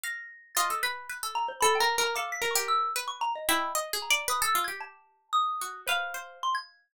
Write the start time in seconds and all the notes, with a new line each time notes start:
0.03 F5 A#6
0.55 F4 D#5 A6
0.70 A4
0.83 B4 B5
1.09 B4
1.23 A4
1.35 A#5
1.48 C5
1.61 A4 B5
1.75 G5
1.80 A#4
1.98 A#4
2.03 A#5
2.15 A4 F5 D6
2.32 B6
2.42 A#4
2.51 C#6
2.55 G4
2.68 E6
2.96 B4
3.08 C#6
3.21 A#5
3.35 D#5
3.49 E4 G5
3.75 D#5
3.93 G#4
4.02 A#5
4.10 D5
4.28 B4 D#6
4.42 A4 E6
4.55 F4
4.64 G4 G#6
4.80 A5
5.33 D#6
5.61 F#4
5.87 B4 C5 F5
6.14 C5
6.43 C6
6.55 G#6